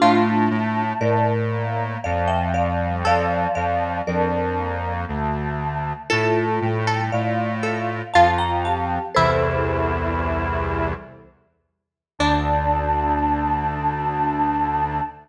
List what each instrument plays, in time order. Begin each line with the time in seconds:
0.00 lead 1 (square) A2, choir aahs A3, marimba D4 F4, harpsichord F4
0.50 lead 1 (square) A2
1.00 lead 1 (square) A2, marimba A#4 D5
1.51 choir aahs A#3
2.02 lead 1 (square) F2, choir aahs F3, marimba D5 F5
2.28 marimba E5 G5
2.54 choir aahs F3, marimba D5 F5
2.80 choir aahs G3
3.05 lead 1 (square) F2, choir aahs F3, harpsichord A4, marimba D5 F5
3.55 lead 1 (square) F2, marimba D5 F5
4.07 lead 1 (square) F2, choir aahs D4, marimba A#4 D5
4.57 choir aahs A#3
5.08 lead 1 (square) D2, choir aahs A3
6.10 lead 1 (square) A2, choir aahs A3, marimba F4 A4, harpsichord A4
6.61 lead 1 (square) A2, choir aahs G3
6.87 harpsichord A4
7.12 lead 1 (square) A2, choir aahs F4, marimba D5 F5
7.63 harpsichord A4
8.14 lead 1 (square) F2, choir aahs F4, harpsichord F4, marimba F5 A5
8.38 marimba G5 A#5
8.64 choir aahs G4, marimba F5 A5
9.15 lead 1 (square) C2 E2, choir aahs E4, harpsichord E4, marimba A4 C5
12.19 lead 1 (square) D2, choir aahs D4, harpsichord D4, marimba D5